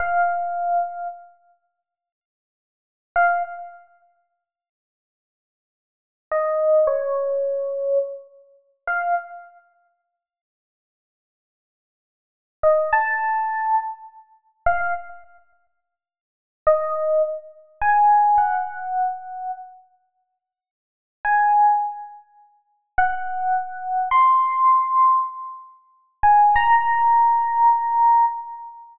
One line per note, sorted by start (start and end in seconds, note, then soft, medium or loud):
0.00 1.08 F5 medium
3.16 3.43 F5 medium
6.32 6.88 D#5 medium
6.87 7.98 C#5 medium
8.87 9.15 F5 medium
12.63 12.91 D#5 medium
12.93 13.75 A5 medium
14.66 14.94 F5 medium
16.67 17.22 D#5 medium
17.82 18.39 G#5 medium
18.38 19.51 F#5 medium
21.25 21.79 G#5 medium
22.98 24.09 F#5 medium
24.11 25.19 C6 medium
26.23 26.58 G#5 medium
26.56 28.25 A#5 loud